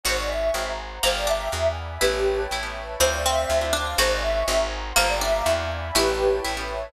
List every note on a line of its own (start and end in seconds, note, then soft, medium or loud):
0.03 0.51 G#1 loud
0.03 0.22 C#4 medium
0.03 0.22 D#4 medium
0.03 0.22 F#4 medium
0.03 0.91 F#4 loud
0.03 0.22 G#4 medium
0.03 0.17 C5 medium
0.03 0.28 C#5 medium
0.03 0.28 D#5 medium
0.03 0.28 F#5 medium
0.03 0.28 G#5 medium
0.18 0.29 D5 medium
0.28 0.54 C#5 medium
0.28 0.54 D#5 medium
0.28 0.69 E5 medium
0.28 0.53 G#5 medium
0.28 0.54 C#6 medium
0.53 0.99 G#1 medium
0.53 0.72 C4 medium
0.53 0.72 F#4 medium
0.53 0.72 G#4 medium
0.53 0.72 A#4 medium
0.53 0.78 C5 medium
0.53 0.78 F#5 medium
0.53 0.78 G#5 medium
0.53 0.78 A#5 medium
0.80 1.04 C5 medium
0.80 1.04 F#5 medium
0.80 1.04 A#5 medium
0.80 1.04 C6 medium
1.03 1.49 G1 loud
1.03 1.23 A#3 loud
1.03 1.21 F4 medium
1.03 1.21 G4 medium
1.03 1.21 A4 medium
1.03 1.21 A#4 medium
1.03 1.15 C5 medium
1.03 1.28 F5 medium
1.03 1.28 G5 medium
1.03 1.29 A5 medium
1.03 1.28 A#5 medium
1.16 1.27 D5 medium
1.27 1.97 D4 medium
1.27 1.68 E5 medium
1.27 1.53 F5 medium
1.27 1.53 G5 medium
1.27 1.53 A#5 medium
1.27 1.53 D6 medium
1.52 1.98 E2 medium
1.52 1.69 D4 medium
1.52 1.69 E4 medium
1.52 1.69 F#4 medium
1.52 1.69 G#4 medium
1.52 1.78 D5 medium
1.52 1.78 E5 medium
1.52 1.79 F#5 medium
1.52 1.78 G#5 medium
1.78 2.02 D5 medium
1.78 2.02 E5 medium
1.78 2.02 G#5 medium
1.78 2.02 B5 medium
2.00 2.47 A1 medium
2.00 2.19 B3 medium
2.00 2.19 C#4 medium
2.00 2.43 E4 loud
2.00 2.41 G4 medium
2.00 2.19 G4 medium
2.00 2.19 A4 medium
2.00 2.49 B4 medium
2.00 2.41 B4 medium
2.00 2.49 C#5 medium
2.00 2.49 G5 medium
2.00 2.49 A5 medium
2.51 2.96 A1 medium
2.51 2.96 E4 medium
2.51 3.00 B4 medium
2.51 3.00 C#5 medium
2.51 2.99 E5 medium
2.51 3.00 A5 medium
2.63 2.80 B3 medium
2.63 2.80 C#4 medium
2.63 2.80 G4 medium
2.63 2.80 A4 medium
3.00 3.45 D2 loud
3.00 3.17 C4 medium
3.00 3.22 C4 loud
3.00 3.17 D4 loud
3.00 3.17 E4 medium
3.00 3.17 F4 medium
3.00 3.10 C5 medium
3.00 3.48 C5 medium
3.00 3.48 D5 medium
3.00 3.49 E5 medium
3.00 3.48 F5 medium
3.12 3.22 D5 medium
3.25 3.68 C4 loud
3.25 3.72 E5 medium
3.48 3.95 D2 loud
3.48 3.97 C5 medium
3.48 3.97 D5 medium
3.48 3.97 F5 medium
3.48 3.97 A5 medium
3.61 3.78 C4 medium
3.61 3.78 D4 medium
3.61 3.78 E4 medium
3.61 3.78 F4 medium
3.73 3.94 D4 loud
3.98 4.43 G#1 loud
3.98 4.16 C#4 medium
3.98 4.16 D#4 loud
3.98 4.16 F#4 medium
3.98 4.85 F#4 loud
3.98 4.16 G#4 loud
3.98 4.10 C5 loud
3.98 4.21 C#5 medium
3.98 4.21 D#5 medium
3.98 4.23 F#5 medium
3.98 4.21 G#5 medium
4.11 4.22 D5 medium
4.22 4.46 C#5 medium
4.22 4.46 D#5 medium
4.22 4.63 E5 medium
4.22 4.46 G#5 medium
4.22 4.46 C#6 medium
4.48 4.93 G#1 loud
4.48 4.65 C4 loud
4.48 4.65 F#4 loud
4.48 4.65 G#4 medium
4.48 4.65 A#4 loud
4.48 4.72 C5 medium
4.48 4.72 F#5 medium
4.48 4.73 G#5 medium
4.48 4.72 A#5 medium
4.72 4.96 C5 medium
4.72 4.96 F#5 medium
4.72 4.96 A#5 medium
4.72 4.96 C6 medium
4.96 5.42 G1 loud
4.96 5.16 A#3 loud
4.96 5.14 F4 loud
4.96 5.14 G4 medium
4.96 5.14 A4 medium
4.96 5.14 A#4 loud
4.96 5.07 C5 medium
4.96 5.20 F5 medium
4.96 5.20 G5 medium
4.96 5.22 A5 medium
4.96 5.20 A#5 medium
5.09 5.20 D5 medium
5.21 5.91 D4 loud
5.21 5.61 E5 medium
5.21 5.45 F5 medium
5.21 5.45 G5 medium
5.21 5.45 A#5 medium
5.21 5.45 D6 medium
5.46 5.91 E2 loud
5.46 5.63 D4 loud
5.46 5.63 E4 loud
5.46 5.63 F#4 loud
5.46 5.63 G#4 medium
5.46 5.70 D5 medium
5.46 5.70 E5 medium
5.46 5.70 F#5 medium
5.46 5.70 G#5 medium
5.71 5.96 D5 medium
5.71 5.96 E5 medium
5.71 5.96 G#5 medium
5.71 5.96 B5 medium
5.94 6.40 A1 loud
5.94 6.12 B3 medium
5.94 6.12 C#4 loud
5.94 6.38 E4 loud
5.94 6.12 G4 loud
5.94 6.36 G4 medium
5.94 6.12 A4 loud
5.94 6.43 B4 medium
5.94 6.36 B4 medium
5.94 6.43 C#5 medium
5.94 6.43 G5 medium
5.94 6.43 A5 medium
6.44 6.90 A1 medium
6.44 6.89 E4 medium
6.44 6.92 B4 medium
6.44 6.92 C#5 medium
6.44 6.92 E5 medium
6.44 6.92 A5 medium
6.57 6.74 B3 medium
6.57 6.74 C#4 medium
6.57 6.74 G4 medium
6.57 6.74 A4 medium